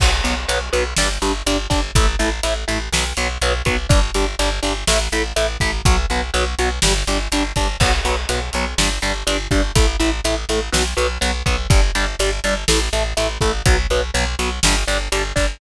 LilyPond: <<
  \new Staff \with { instrumentName = "Overdriven Guitar" } { \time 4/4 \key b \minor \tempo 4 = 123 <fis b>8 <fis b>8 <fis b>8 <fis b>8 <g d'>8 <g d'>8 <g d'>8 <g d'>8 | <a e'>8 <a e'>8 <a e'>8 <a e'>8 <fis b>8 <fis b>8 <fis b>8 <fis b>8 | <g d'>8 <g d'>8 <g d'>8 <g d'>8 <a e'>8 <a e'>8 <a e'>8 <a e'>8 | <fis b>8 <fis b>8 <fis b>8 <fis b>8 <g d'>8 <g d'>8 <g d'>8 <g d'>8 |
<fis b>8 <fis b>8 <fis b>8 <fis b>8 <g d'>8 <g d'>8 <g d'>8 <g d'>8 | <a e'>8 <a e'>8 <a e'>8 <a e'>8 <fis b>8 <fis b>8 <fis b>8 <fis b>8 | <g d'>8 <g d'>8 <g d'>8 <g d'>8 <a e'>8 <a e'>8 <a e'>8 <a e'>8 | <fis b>8 <fis b>8 <fis b>8 <fis b>8 <g d'>8 <g d'>8 <g d'>8 <g d'>8 | }
  \new Staff \with { instrumentName = "Electric Bass (finger)" } { \clef bass \time 4/4 \key b \minor b,,8 b,,8 b,,8 b,,8 g,,8 g,,8 g,,8 g,,8 | a,,8 a,,8 a,,8 a,,8 b,,8 b,,8 b,,8 b,,8 | g,,8 g,,8 g,,8 g,,8 a,,8 a,,8 a,,8 a,,8 | b,,8 b,,8 b,,8 b,,8 g,,8 g,,8 g,,8 g,,8 |
b,,8 b,,8 b,,8 b,,8 g,,8 g,,8 g,,8 g,,8 | a,,8 a,,8 a,,8 a,,8 b,,8 b,,8 b,,8 b,,8 | g,,8 g,,8 g,,8 g,,8 a,,8 a,,8 a,,8 a,,8 | b,,8 b,,8 b,,8 b,,8 g,,8 g,,8 g,,8 g,,8 | }
  \new DrumStaff \with { instrumentName = "Drums" } \drummode { \time 4/4 <cymc bd>8 hh8 hh8 hh8 sn8 hh8 hh8 <hh bd>8 | <hh bd>8 hh8 hh8 hh8 sn8 hh8 hh8 <hh bd>8 | <hh bd>8 hh8 hh8 hh8 sn8 hh8 hh8 <hh bd>8 | <hh bd>4 hh8 hh8 sn8 hh8 hh8 <hh bd>8 |
<cymc bd>8 hh8 hh8 hh8 sn8 hh8 hh8 <hh bd>8 | <hh bd>8 hh8 hh8 hh8 sn8 hh8 hh8 <hh bd>8 | <hh bd>8 hh8 hh8 hh8 sn8 hh8 hh8 <hh bd>8 | <hh bd>4 hh8 hh8 sn8 hh8 hh8 <hh bd>8 | }
>>